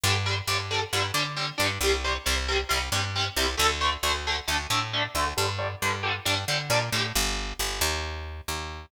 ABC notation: X:1
M:4/4
L:1/8
Q:1/4=135
K:Gm
V:1 name="Overdriven Guitar"
[D,G,] [D,G,] [D,G,] [D,G,] [D,G,] [D,G,] [D,G,] [D,G,] | [C,G,] [C,G,] [C,G,] [C,G,] [C,G,] [C,G,] [C,G,] [C,G,] | [D,A,] [D,A,] [D,A,] [D,A,] [D,A,] [D,A,] [D,A,] [D,A,] | [D,G,] [D,G,] [D,G,] [D,G,] [D,G,] [D,G,] [D,G,] [D,G,] |
z8 |]
V:2 name="Electric Bass (finger)" clef=bass
G,,2 G,,2 G,, D,2 G,, | C,,2 C,,2 C,, G,,2 C,, | D,,2 D,,2 D,, A,,2 D,, | G,,2 G,,2 G,, D, B,, A,, |
G,,,2 G,,, E,,3 E,,2 |]